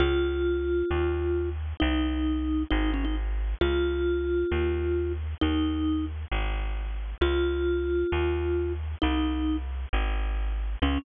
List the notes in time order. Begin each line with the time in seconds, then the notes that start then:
0.00 C#2 F4
0.91 D#2
1.80 C2 D#4
2.71 G#1 D#4
2.94 C#4
3.05 D#4
3.61 C#2 F4
4.52 D#2
5.41 D#2 D#4
6.31 G#1
7.21 C#2 F4
8.12 D#2
9.02 C2 D#4
9.93 G#1
10.82 C#2 C#4